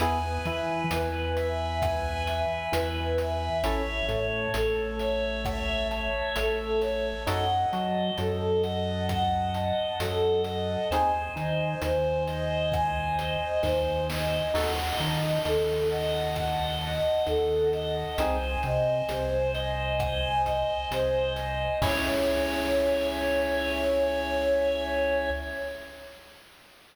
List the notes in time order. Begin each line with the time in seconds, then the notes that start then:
0.00 E2 B3 E4 G#4 B4 G#5, closed hi-hat
0.45 E3 E4 E5 G#5, closed hi-hat
0.91 E2 E3 B4, closed hi-hat
1.36 E5, closed hi-hat
1.82 B4 G#5, kick, cross-stick
2.27 E5 G#5, closed hi-hat
2.71 E2 E3 B4 E5, closed hi-hat
3.18 B4 E5, closed hi-hat
3.64 A1 C#4 E4 A4 C#5 E5, closed hi-hat
4.08 A2 A3 C#5 A5, closed hi-hat
4.54 A1 A3 A4 C#5, closed hi-hat
4.99 C#5 E5, closed hi-hat
5.45 C#5 E5, kick, cross-stick
5.91 C#5 A5, closed hi-hat
6.36 A1 A3 A4 E5, closed hi-hat
6.81 C#5, snare, closed hi-hat
7.27 F#2 D#4 F#4 A4 D#5 F#5, closed hi-hat
7.73 F#3 F#4 D#5 A5, closed hi-hat
8.18 F#2 F#3 A4 D#5, closed hi-hat
8.63 D#5 F#5, closed hi-hat
9.09 D#5 F#5, kick, cross-stick
9.53 D#5 A5, closed hi-hat
9.99 F#2 F#3 A4 F#5, closed hi-hat
10.44 D#5, closed hi-hat
10.90 D#2 C4 D#4 G#4 C5 G#5, closed hi-hat
11.36 D#3 D#4 D#5 G#5, closed hi-hat
11.81 D#2 D#3 C5, closed hi-hat
12.27 D#5, closed hi-hat
12.72 C5 G#5, kick, cross-stick
13.18 D#5 G#5, closed hi-hat
13.63 D#2 D#3 C5 D#5, kick, snare
14.09 C5 D#5, snare
14.53 D#2 D#4 F#4 A4 D#5 F#5, crash
14.98 D#3 D#4 D#5 A5, closed hi-hat
15.45 D#2 D#3 A4 D#5, closed hi-hat
15.89 D#5 F#5, closed hi-hat
16.36 D#5 F#5, kick, cross-stick
16.80 D#5 A5
17.26 D#2 D#3 A4 F#5, closed hi-hat
17.72 D#5, closed hi-hat
18.18 C2 C4 D#4 G#4 C5 G#5, closed hi-hat
18.63 C3 C4 D#5 G#5, closed hi-hat
19.09 C2 C3 C5, closed hi-hat
19.53 D#5, closed hi-hat
19.99 C5 G#5, kick, cross-stick
20.45 D#5 G#5, kick, closed hi-hat
20.91 C2 C3 C5 D#5, closed hi-hat
21.36 C5 D#5, closed hi-hat
21.82 C#2 C#4 E4 G#4 C#5 E5 G#5, kick, crash